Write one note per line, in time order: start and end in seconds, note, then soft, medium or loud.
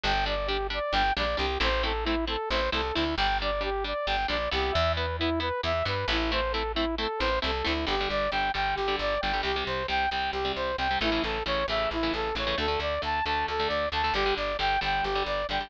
0.04 0.80 G1 loud
0.04 0.12 G3 medium
0.04 0.12 D4 medium
0.04 0.25 G5 medium
0.26 0.35 G3 medium
0.26 0.35 D4 medium
0.26 0.48 D5 medium
0.47 0.57 G3 medium
0.47 0.57 D4 medium
0.47 0.67 G4 medium
0.70 0.79 G3 medium
0.70 0.79 D4 medium
0.70 0.94 D5 medium
0.93 1.12 G1 medium
0.93 1.03 G3 medium
0.93 1.03 D4 medium
0.93 1.13 G5 medium
1.17 1.36 A#1 medium
1.17 1.26 G3 medium
1.17 1.26 D4 medium
1.17 1.37 D5 medium
1.37 1.58 C2 medium
1.37 1.46 G3 medium
1.37 1.46 D4 medium
1.37 1.59 G4 medium
1.60 2.37 A1 loud
1.60 1.69 A3 medium
1.60 1.69 C4 loud
1.60 1.69 E4 loud
1.60 1.83 C5 medium
1.83 1.92 A3 medium
1.83 1.92 C4 medium
1.83 1.92 E4 medium
1.83 2.04 A4 medium
2.04 2.15 A3 medium
2.04 2.15 C4 medium
2.04 2.25 E4 medium
2.04 2.15 E4 medium
2.27 2.36 A3 medium
2.27 2.36 C4 medium
2.27 2.36 E4 medium
2.27 2.49 A4 medium
2.50 2.69 A1 medium
2.50 2.61 A3 medium
2.50 2.61 C4 medium
2.50 2.61 E4 medium
2.50 2.70 C5 medium
2.72 2.92 C2 medium
2.72 2.81 A3 medium
2.72 2.81 C4 medium
2.72 2.81 E4 medium
2.72 2.94 A4 medium
2.94 3.15 D2 medium
2.94 3.04 A3 medium
2.94 3.04 C4 medium
2.94 3.15 E4 medium
2.94 3.04 E4 medium
3.17 3.94 G1 loud
3.17 3.27 G3 loud
3.17 3.27 D4 loud
3.17 3.38 G5 medium
3.42 3.51 G3 medium
3.42 3.51 D4 medium
3.42 3.63 D5 medium
3.61 3.70 G3 medium
3.61 3.70 D4 medium
3.61 3.84 G4 medium
3.84 3.93 G3 medium
3.84 3.93 D4 medium
3.84 4.07 D5 medium
4.07 4.26 G1 medium
4.07 4.16 G3 medium
4.07 4.16 D4 medium
4.07 4.27 G5 medium
4.28 4.49 A#1 medium
4.28 4.37 G3 medium
4.28 4.37 D4 medium
4.28 4.50 D5 medium
4.51 4.71 C2 medium
4.51 4.83 B3 loud
4.51 4.83 E4 medium
4.51 4.73 G4 medium
4.72 5.51 E2 loud
4.72 4.93 E5 medium
4.96 5.06 B3 medium
4.96 5.06 E4 loud
4.96 5.17 B4 soft
5.19 5.30 B3 medium
5.19 5.40 E4 medium
5.19 5.30 E4 loud
5.40 5.49 B3 medium
5.40 5.49 E4 medium
5.40 5.61 B4 medium
5.63 5.83 E2 medium
5.63 5.72 B3 medium
5.63 5.72 E4 medium
5.63 5.85 E5 medium
5.85 6.05 G2 medium
5.85 5.94 B3 medium
5.85 5.94 E4 medium
5.85 6.07 B4 medium
6.08 7.06 A1 loud
6.08 6.18 B3 medium
6.08 6.18 E4 medium
6.08 6.31 E4 medium
6.32 6.41 A3 medium
6.32 6.41 C4 medium
6.32 6.41 E4 medium
6.32 6.53 C5 medium
6.52 6.63 A3 medium
6.52 6.63 C4 medium
6.52 6.63 E4 medium
6.52 6.72 A4 medium
6.75 6.85 A3 medium
6.75 6.85 C4 medium
6.75 6.95 E4 medium
6.75 6.85 E4 medium
6.98 7.07 A3 medium
6.98 7.07 C4 medium
6.98 7.07 E4 medium
6.98 7.20 A4 medium
7.19 7.39 A1 medium
7.19 7.29 A3 medium
7.19 7.29 C4 medium
7.19 7.29 E4 medium
7.19 7.39 C5 medium
7.42 7.63 C2 medium
7.42 7.51 A3 medium
7.42 7.51 C4 medium
7.42 7.51 E4 medium
7.42 7.66 A4 medium
7.64 7.86 D2 medium
7.64 7.73 A3 loud
7.64 7.73 C4 medium
7.64 7.73 E4 medium
7.64 7.85 E4 medium
7.87 8.07 G1 medium
7.87 7.96 D3 loud
7.87 7.96 G3 loud
7.87 8.09 G4 medium
8.01 8.27 D3 medium
8.01 8.27 G3 medium
8.10 8.29 G1 medium
8.10 8.31 D5 medium
8.31 8.51 G1 medium
8.31 8.50 D3 medium
8.31 8.50 G3 medium
8.31 8.52 G5 medium
8.54 8.74 G1 medium
8.54 8.81 D3 medium
8.54 8.81 G3 medium
8.54 8.75 G5 medium
8.75 8.97 G1 medium
8.75 8.96 G4 medium
8.88 9.15 D3 medium
8.88 9.15 G3 medium
8.99 9.18 G1 medium
8.99 9.21 D5 medium
9.21 9.42 G1 medium
9.21 9.32 D3 medium
9.21 9.32 G3 medium
9.21 9.41 G5 medium
9.33 9.42 D3 medium
9.33 9.42 G3 medium
9.43 9.63 C2 medium
9.43 9.52 C3 medium
9.43 9.52 G3 medium
9.43 9.64 G4 medium
9.56 9.83 C3 medium
9.56 9.83 G3 medium
9.66 9.86 C2 medium
9.66 9.87 C5 medium
9.88 10.08 C2 medium
9.88 10.06 C3 medium
9.88 10.06 G3 medium
9.88 10.10 G5 medium
10.10 10.30 C2 medium
10.10 10.39 C3 medium
10.10 10.39 G3 medium
10.10 10.31 G5 medium
10.32 10.52 C2 medium
10.32 10.52 G4 medium
10.45 10.72 C3 medium
10.45 10.72 G3 medium
10.56 10.75 C2 medium
10.56 10.76 C5 medium
10.78 10.97 C2 medium
10.78 10.88 C3 medium
10.78 10.88 G3 medium
10.78 10.99 G5 medium
10.91 11.00 C3 medium
10.91 11.00 G3 medium
11.01 11.20 A1 medium
11.01 11.10 C#3 medium
11.01 11.10 E3 loud
11.01 11.10 A3 loud
11.01 11.23 E4 medium
11.12 11.39 C#3 medium
11.12 11.39 E3 medium
11.12 11.39 A3 medium
11.23 11.43 A1 medium
11.23 11.44 A4 medium
11.46 11.65 A1 medium
11.46 11.64 C#3 medium
11.46 11.64 E3 medium
11.46 11.64 A3 medium
11.46 11.66 C#5 medium
11.68 11.87 A1 medium
11.68 11.96 C#3 medium
11.68 11.96 E3 medium
11.68 11.96 A3 medium
11.68 11.90 E5 medium
11.91 12.10 A1 medium
11.91 12.13 E4 medium
12.03 12.30 C#3 medium
12.03 12.30 E3 medium
12.03 12.30 A3 medium
12.14 12.33 A1 medium
12.14 12.35 A4 medium
12.35 12.54 A1 medium
12.35 12.45 C#3 medium
12.35 12.45 E3 medium
12.35 12.45 A3 medium
12.35 12.57 C#5 medium
12.47 12.56 C#3 medium
12.47 12.56 E3 medium
12.47 12.56 A3 medium
12.58 12.77 D2 medium
12.58 12.67 D3 medium
12.58 12.67 A3 medium
12.58 12.80 A4 medium
12.68 12.95 D3 medium
12.68 12.95 A3 medium
12.80 12.99 D2 medium
12.80 13.02 D5 medium
13.02 13.22 D2 medium
13.02 13.20 D3 medium
13.02 13.20 A3 medium
13.02 13.25 A5 medium
13.26 13.45 D2 medium
13.26 13.53 D3 medium
13.26 13.53 A3 medium
13.26 13.46 A5 medium
13.48 13.67 D2 medium
13.48 13.68 A4 medium
13.60 13.86 D3 medium
13.60 13.86 A3 medium
13.68 13.89 D2 medium
13.68 13.89 D5 medium
13.92 14.11 D2 medium
13.92 14.02 D3 medium
13.92 14.02 A3 medium
13.92 14.14 A5 medium
14.04 14.13 D3 medium
14.04 14.13 A3 medium
14.14 14.33 G1 medium
14.14 14.24 D3 loud
14.14 14.24 G3 medium
14.14 14.34 G4 medium
14.26 14.53 D3 medium
14.26 14.53 G3 medium
14.37 14.57 G1 medium
14.37 14.57 D5 medium
14.59 14.78 G1 medium
14.59 14.77 D3 medium
14.59 14.77 G3 medium
14.59 14.80 G5 medium
14.81 15.01 G1 medium
14.81 15.08 D3 medium
14.81 15.08 G3 medium
14.81 15.05 G5 medium
15.03 15.23 G1 medium
15.03 15.24 G4 medium
15.15 15.42 D3 medium
15.15 15.42 G3 medium
15.26 15.45 G1 medium
15.26 15.47 D5 medium
15.49 15.68 G1 medium
15.49 15.60 D3 medium
15.49 15.60 G3 medium
15.49 15.70 G5 medium
15.61 15.69 D3 medium
15.61 15.69 G3 medium